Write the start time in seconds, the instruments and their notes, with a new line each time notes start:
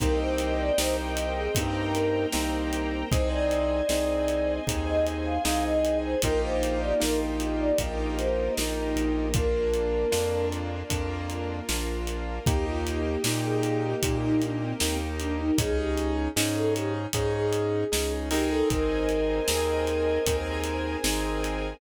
0.00 synth bass 1 C2, acoustic grand piano A#3 C4 D#4 G4, string ensemble 1 A#4 C5 D#5 G5, ocarina A#4, kick, closed hi-hat
0.19 ocarina C5
0.38 closed hi-hat
0.59 ocarina D5
0.78 synth bass 1 C2, acoustic grand piano A#3 C4 D#4 G4, ocarina C5, snare
1.17 closed hi-hat
1.36 ocarina G#4
1.55 synth bass 1 G2, acoustic grand piano A#3 C4 D#4 G4, string ensemble 1 A#4 C5 G5 A#5, kick, closed hi-hat
1.94 ocarina A#4, closed hi-hat
2.32 synth bass 1 C2, acoustic grand piano A#3 C4 D#4 G4, snare
2.73 closed hi-hat
3.11 synth bass 1 C2, acoustic grand piano C4 D#4 G#4, ocarina C5, string ensemble 1 C5 D#5 G#5, kick, closed hi-hat
3.31 ocarina D5
3.51 closed hi-hat
3.89 synth bass 1 C2, acoustic grand piano C4 D#4 G#4, snare
4.28 closed hi-hat
4.67 synth bass 1 D#2, acoustic grand piano C4 D#4 G#4, string ensemble 1 G#4 C5 G#5, kick, closed hi-hat
4.87 ocarina D#5
5.06 closed hi-hat
5.25 ocarina F5
5.45 synth bass 1 C2, acoustic grand piano C4 D#4 G#4, ocarina F5, snare
5.65 ocarina D#5
5.85 closed hi-hat
6.03 ocarina C5
6.22 synth bass 1 A#1, string ensemble 1 A#3 D#4 F4 G4, acoustic grand piano A#3 D#4 F4 G4, ocarina A#4, kick, closed hi-hat
6.44 ocarina C5
6.63 closed hi-hat
6.81 ocarina D5
7.00 synth bass 1 A#1, acoustic grand piano A#3 D#4 F4 G4, ocarina A#4, snare
7.40 closed hi-hat
7.60 ocarina D5
7.78 synth bass 1 A#1, string ensemble 1 A#3 D#4 G4 A#4, acoustic grand piano A#3 D#4 F4 G4, kick, closed hi-hat
8.17 ocarina C5, closed hi-hat
8.57 synth bass 1 A#1, acoustic grand piano A#3 D#4 F4 G4, snare
8.96 synth bass 1 A#1, closed hi-hat
9.34 string ensemble 1 A#3 D4 F4, acoustic grand piano A#3 D4 F4, ocarina A#4, kick, closed hi-hat
9.74 closed hi-hat
10.12 synth bass 1 F2, acoustic grand piano A#3 D4 F4, snare
10.52 closed hi-hat
10.90 synth bass 1 F2, acoustic grand piano A#3 D4 F4, string ensemble 1 A#3 F4 A#4, kick, closed hi-hat
11.30 closed hi-hat
11.69 synth bass 1 A#1, acoustic grand piano A#3 D4 F4, snare
12.07 closed hi-hat
12.46 synth bass 1 D#2, acoustic grand piano A#3 D#4 G4, string ensemble 1 A#3 D#4 G4, ocarina G4, kick, closed hi-hat
12.66 ocarina F4
12.87 closed hi-hat
13.04 ocarina G4
13.24 synth bass 1 A#2, acoustic grand piano A#3 D#4 G4, snare
13.44 ocarina G#4
13.63 ocarina G#4, closed hi-hat
13.82 ocarina G4
14.03 synth bass 1 A#2, acoustic grand piano A#3 D#4 G4, string ensemble 1 A#3 G4 A#4, kick, closed hi-hat
14.23 ocarina D#4
14.42 ocarina D4, closed hi-hat
14.62 ocarina C4
14.80 synth bass 1 D#2, acoustic grand piano A#3 D#4 G4, snare
15.19 ocarina D4, closed hi-hat
15.38 ocarina D#4
15.58 synth bass 1 C#2, acoustic grand piano C#4 D#4 G#4, ocarina G#4, kick, closed hi-hat
15.77 ocarina G4
15.98 closed hi-hat
16.36 synth bass 1 G#2, acoustic grand piano C#4 D#4 G#4, snare
16.56 ocarina A4
16.75 ocarina G4, closed hi-hat
17.13 synth bass 1 G#2, acoustic grand piano C#4 D#4 G#4, ocarina G#4, kick, closed hi-hat
17.34 ocarina G#4
17.53 closed hi-hat
17.92 synth bass 1 C#2, acoustic grand piano C#4 D#4 G#4, snare
18.31 acoustic grand piano C4 D#4 G#4 A#4, ocarina G4, open hi-hat
18.50 ocarina A4
18.70 synth bass 1 G#1, string ensemble 1 A#4 C5 D#5 G#5, ocarina A#4, kick, closed hi-hat
19.09 closed hi-hat
19.48 synth bass 1 D#2, acoustic grand piano C4 D#4 G#4 A#4, snare
19.87 closed hi-hat
20.26 synth bass 1 D#2, acoustic grand piano C4 D#4 G#4 A#4, string ensemble 1 G#4 A#4 C5 G#5, kick, closed hi-hat
20.64 closed hi-hat
21.04 synth bass 1 G#1, acoustic grand piano C4 D#4 G#4 A#4, snare
21.44 closed hi-hat